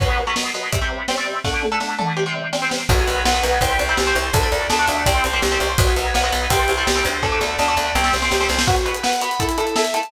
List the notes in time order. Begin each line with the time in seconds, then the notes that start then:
0.00 B2 F#3 B3, kick, crash
0.27 B2 F#3 B3
0.36 B2 F#3 B3, snare
0.54 B2 F#3 B3, snare
0.72 C3 G3 C4, kick, closed hi-hat
0.81 C3 G3 C4
1.08 C3 G3 C4, snare
1.17 C3 G3 C4
1.44 D3 A3 D4, kick, snare
1.63 high tom
1.72 D3 A3 D4
1.80 D3 A3 D4, snare
1.98 D3 A3 D4, mid tom
2.17 C3 G3 C4
2.26 C3 G3 C4
2.53 C3 G3 C4, snare
2.62 C3 G3 C4
2.71 snare
2.89 B1 F#3 B3 F#4, kick, crash
2.98 F#3 B3
3.07 B1 F#3 B3 B4, ride
3.25 B1 F#3 B3 F#5, snare
3.34 F#3 B3
3.43 B1 F#3 B3 B4, snare, ride
3.61 C2 G3 C4 G5, kick, ride
3.79 C2 C5, ride
3.89 G3 C4
3.97 C2 G4, snare
4.07 G3 C4
4.15 C2 C5, ride
4.33 D2 A3 D4 A4, kick, ride
4.43 A3 D4
4.52 D2 A3 D4 D5, ride
4.70 D2 A3 D4 A5, snare
4.79 A3 D4
4.88 D2 A3 D4 D5, snare, ride
5.06 C2 G3 C4 G5, kick, ride
5.24 C2 C5, ride
5.33 G3 C4
5.42 C2 G4, snare
5.52 G3 C4
5.60 C2 C5, ride
5.78 B1 F#3 B3 F#4, kick, ride
5.87 F#3 B3
5.96 B1 F#3 B3 B4, ride
6.14 B1 F#3 B3 F#5, snare
6.24 F#3 B3
6.32 B1 F#3 B3 B4, snare, ride
6.50 C2 G3 C4 G5, kick, ride
6.68 C2 C5, ride
6.78 G3 C4
6.87 C2 G4, snare
6.96 G3 C4
7.05 D2 C5, ride
7.23 A3 D4 A4, kick, snare
7.32 A3 D4
7.41 D2 A3 D4 D5, snare
7.59 D2 A3 D4 A5, snare
7.68 A3 D4
7.77 D2 A3 D4 D5, snare
7.95 C2 G3 C4 G5, snare
8.04 snare
8.13 C2 C5, snare
8.22 G3 C4, snare
8.31 C#2 G4, snare
8.41 G3 C4, snare
8.49 C2 C5, snare
8.59 snare
8.67 B3 F#4 B4, kick, crash
8.76 closed hi-hat
8.85 B3 F#4 B4, closed hi-hat
8.95 closed hi-hat
9.03 B3 F#4 B4 F#5, snare
9.13 closed hi-hat
9.21 B3 F#4 B4 B5, closed hi-hat
9.31 closed hi-hat
9.40 A3 E4 A4, kick, closed hi-hat
9.49 closed hi-hat
9.58 A3 E4 A4, closed hi-hat
9.67 closed hi-hat
9.76 A3 E4 A4 E5, snare
9.85 closed hi-hat
9.94 A3 E4 A4 A5, closed hi-hat
10.03 closed hi-hat